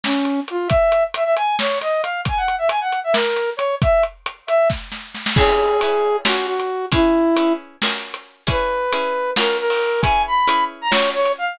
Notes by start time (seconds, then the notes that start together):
0.04 C#4, snare
0.25 closed hi-hat
0.48 F4, closed hi-hat
0.68 E5, kick, closed hi-hat
0.92 closed hi-hat
1.14 E5, closed hi-hat
1.24 E5
1.36 G#5, closed hi-hat
1.59 C#5, snare
1.81 D#5, closed hi-hat
2.02 F5, closed hi-hat
2.25 G#5, kick, closed hi-hat
2.37 F#5
2.48 closed hi-hat
2.58 E5
2.69 G#5, closed hi-hat
2.81 F#5
2.92 closed hi-hat
3.04 E5
3.13 A#4, snare
3.36 closed hi-hat
3.57 C#5, closed hi-hat
3.82 E5, kick, closed hi-hat
4.03 closed hi-hat
4.26 closed hi-hat
4.47 E5, closed hi-hat
4.70 kick, snare
4.92 snare
5.15 snare
5.26 snare
5.36 C#4 E4 G#4 B4, kick, crash
5.81 C#4 E4 G#4 B4, closed hi-hat
6.25 C#4 F4 F#4 A#4, snare
6.47 F#4
6.60 closed hi-hat
6.92 C#4 E4 G#4 B4, kick, closed hi-hat
7.36 C#4 E4 G#4 B4, closed hi-hat
7.82 C#4 F4 F#4 A#4, snare
8.14 closed hi-hat
8.47 C#4 E4 G#4 B4, kick, closed hi-hat
8.92 C#4 E4 G#4 B4, closed hi-hat
9.36 C#4 F4 F#4 A#4, snare
9.59 A#4
9.70 open hi-hat
10.02 C#4 E4 G#4 B4 G#5, kick, closed hi-hat
10.27 B5
10.47 C#4 E4 G#4 B4, closed hi-hat
10.82 A#5
10.91 C#4 F4 F#4 A#4 C#5, snare
11.14 C#5
11.25 closed hi-hat
11.38 F5